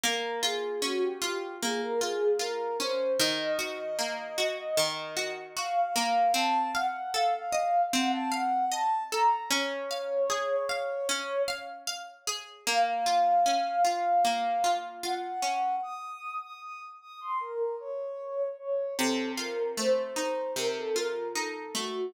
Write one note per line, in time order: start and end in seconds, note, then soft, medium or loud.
0.04 1.62 A#3 medium
0.04 0.39 A#4 medium
0.43 1.21 F4 medium
0.43 0.81 G#4 medium
0.82 2.79 C#4 medium
0.82 1.01 F#4 medium
1.02 1.56 G4 medium
1.22 2.01 F4 medium
1.62 3.13 A#3 medium
1.62 1.80 G#4 medium
1.81 2.00 A#4 medium
2.01 2.39 F4 medium
2.01 2.33 G#4 medium
2.39 3.14 F4 medium
2.39 2.77 A#4 medium
2.80 3.17 C#4 medium
2.80 3.12 C5 medium
3.19 4.77 D#3 loud
3.19 5.31 D#5 medium
3.59 4.38 F#4 medium
3.99 5.95 A#3 medium
4.38 5.16 F#4 medium
4.77 6.27 D#3 medium
5.17 5.56 F#4 medium
5.56 6.32 F#4 medium
5.56 6.32 F5 medium
5.96 6.33 A#3 medium
6.34 7.93 C4 medium
6.34 6.71 A5 loud
6.75 8.31 F5 medium
6.75 7.10 F#5 medium
7.14 9.12 A4 medium
7.14 7.33 F5 medium
7.34 7.82 F5 medium
7.52 8.71 D#5 medium
7.93 9.43 C4 medium
7.93 8.12 F#5 medium
8.13 8.32 A5 loud
8.32 9.44 F5 medium
8.32 8.65 F#5 medium
8.72 9.47 D#5 medium
8.72 9.04 A5 medium
9.12 9.50 A4 medium
9.12 9.43 A#5 medium
9.51 11.09 C#4 medium
9.51 11.43 C#5 medium
9.91 10.69 F5 medium
10.30 12.27 G#4 medium
10.69 11.48 F5 medium
11.09 12.59 C#4 medium
11.48 11.87 F5 medium
11.87 12.62 F5 medium
12.27 12.65 G#4 medium
12.67 14.24 A#3 medium
12.67 14.70 F5 medium
13.06 13.84 F4 medium
13.46 15.42 C#4 medium
13.85 14.63 F4 medium
14.25 15.75 A#3 medium
14.64 15.03 F4 medium
15.03 15.78 F4 medium
15.03 15.75 F#5 medium
15.42 15.80 C#4 medium
15.83 16.35 D#6 medium
16.42 16.61 D#6 medium
16.62 16.80 D#6 medium
17.01 17.20 D#6 medium
17.21 17.39 C6 medium
17.40 17.75 A#4 medium
17.80 18.49 C#5 medium
18.59 18.94 C#5 medium
18.98 20.56 C3 medium
18.98 19.31 A4 medium
19.38 20.95 F4 medium
19.38 19.71 A#4 medium
19.77 21.74 A3 medium
19.77 19.96 C5 medium
19.97 20.51 C5 medium
20.16 21.35 D#4 medium
20.56 22.06 C3 medium
20.56 20.75 A#4 medium
20.76 20.95 A4 medium
20.96 22.08 F4 medium
20.96 21.27 A#4 medium
21.35 22.11 D#4 medium
21.35 21.73 A4 medium
21.75 22.12 A3 medium
21.75 22.10 F#4 medium